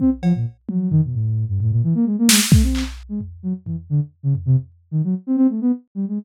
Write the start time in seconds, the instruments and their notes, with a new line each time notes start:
0.00 ocarina C4, kick
0.22 ocarina F3, cowbell
0.35 ocarina A#2
0.68 ocarina F#3, high tom
0.91 ocarina D#3, floor tom
1.04 ocarina B2
1.14 ocarina A2
1.48 ocarina G2
1.60 ocarina A2, floor tom
1.71 ocarina A#2
1.83 ocarina E3
1.95 ocarina A#3
2.06 ocarina G#3
2.19 ocarina A#3
2.29 ocarina G#3, snare
2.52 ocarina A3, kick
2.63 ocarina C4
2.75 clap
3.09 ocarina G#3
3.21 floor tom
3.43 ocarina F#3
3.66 ocarina E3, floor tom
3.90 ocarina D3
4.23 ocarina C#3
4.35 floor tom
4.46 ocarina C3
4.91 ocarina D#3
5.04 ocarina F#3
5.27 ocarina C4
5.37 ocarina C4
5.50 ocarina A3
5.61 ocarina B3
5.95 ocarina G3
6.08 ocarina G#3